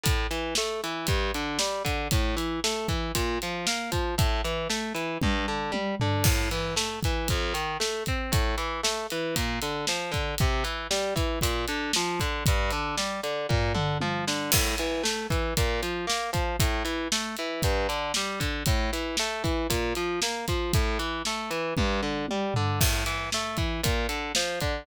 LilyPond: <<
  \new Staff \with { instrumentName = "Overdriven Guitar" } { \time 4/4 \key a \phrygian \tempo 4 = 116 a,8 e8 a8 e8 g,8 d8 g8 d8 | a,8 e8 a8 e8 bes,8 f8 bes8 f8 | a,8 e8 a8 e8 g,8 d8 g8 d8 | a,8 e8 a8 e8 f,8 ees8 a8 c'8 |
a,8 e8 a8 e8 bes,8 d8 f8 d8 | c8 e8 g8 e8 bes,8 d8 f8 d8 | g,8 d8 g8 d8 bes,8 d8 f8 d8 | a,8 e8 a8 e8 bes,8 f8 bes8 f8 |
a,8 e8 a8 e8 g,8 d8 g8 d8 | a,8 e8 a8 e8 bes,8 f8 bes8 f8 | a,8 e8 a8 e8 g,8 d8 g8 d8 | a,8 e8 a8 e8 bes,8 d8 f8 d8 | }
  \new DrumStaff \with { instrumentName = "Drums" } \drummode { \time 4/4 <hh bd>8 hh8 sn8 hh8 <hh bd>8 hh8 sn8 <hh bd>8 | <hh bd>8 hh8 sn8 <hh bd>8 <hh bd>8 hh8 sn8 <hh bd>8 | <hh bd>8 hh8 sn8 hh8 <bd tommh>4 tommh8 tomfh8 | <cymc bd>8 hh8 sn8 <hh bd>8 <hh bd>8 hh8 sn8 <hh bd>8 |
<hh bd>8 hh8 sn8 hh8 <hh bd>8 hh8 sn8 <hh bd>8 | <hh bd>8 hh8 sn8 <hh bd>8 <hh bd>8 hh8 sn8 <hh bd>8 | <hh bd>8 hh8 sn8 hh8 <bd tomfh>8 toml8 tommh8 sn8 | <cymc bd>8 hh8 sn8 <hh bd>8 <hh bd>8 hh8 sn8 <hh bd>8 |
<hh bd>8 hh8 sn8 hh8 <hh bd>8 hh8 sn8 <hh bd>8 | <hh bd>8 hh8 sn8 <hh bd>8 <hh bd>8 hh8 sn8 <hh bd>8 | <hh bd>8 hh8 sn8 hh8 <bd tommh>4 tommh8 tomfh8 | <cymc bd>8 hh8 sn8 <hh bd>8 <hh bd>8 hh8 sn8 <hh bd>8 | }
>>